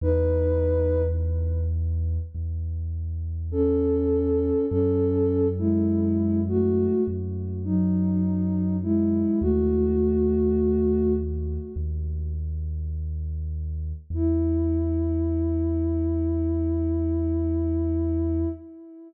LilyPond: <<
  \new Staff \with { instrumentName = "Ocarina" } { \time 4/4 \key e \major \tempo 4 = 51 <dis' b'>4 r2 <cis' a'>4 | <cis' a'>8. <gis e'>8. <a fis'>8 r8 <fis dis'>4 <gis e'>8 | <a fis'>4. r2 r8 | e'1 | }
  \new Staff \with { instrumentName = "Synth Bass 2" } { \clef bass \time 4/4 \key e \major e,2 e,2 | fis,2 fis,2 | dis,2 dis,2 | e,1 | }
>>